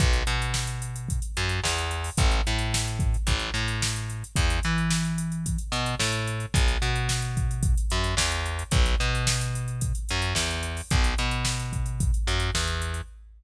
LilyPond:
<<
  \new Staff \with { instrumentName = "Electric Bass (finger)" } { \clef bass \time 4/4 \key b \major \tempo 4 = 110 b,,8 b,2 fis,8 e,4 | a,,8 a,4. a,,8 a,4. | e,8 e2 b,8 a,4 | b,,8 b,2 fis,8 e,4 |
b,,8 b,2 fis,8 e,4 | b,,8 b,2 fis,8 e,4 | }
  \new DrumStaff \with { instrumentName = "Drums" } \drummode { \time 4/4 <hh bd>16 hh16 hh16 hh16 sn16 hh16 hh16 hh16 <hh bd>16 hh16 hh16 hh16 sn16 hh16 hh16 hho16 | <hh bd>16 hh16 hh16 hh16 sn16 hh16 <hh bd>16 hh16 <hh bd>16 hh16 hh16 hh16 sn16 hh16 hh16 hh16 | <hh bd>16 hh16 hh16 hh16 sn16 hh16 hh16 hh16 <hh bd>16 hh16 hh16 hh16 sn16 hh16 hh16 hh16 | <hh bd>16 hh16 hh16 hh16 sn16 hh16 <hh bd>16 hh16 <hh bd>16 hh16 hh16 hh16 sn16 hh16 hh16 hh16 |
<hh bd>16 hh16 hh16 hh16 sn16 hh16 hh16 hh16 <hh bd>16 hh16 hh16 hh16 sn16 hh16 hh16 hho16 | <hh bd>16 hh16 hh16 hh16 sn16 hh16 <hh bd>16 hh16 <hh bd>16 hh16 hh16 hh16 sn16 hh16 hh16 hh16 | }
>>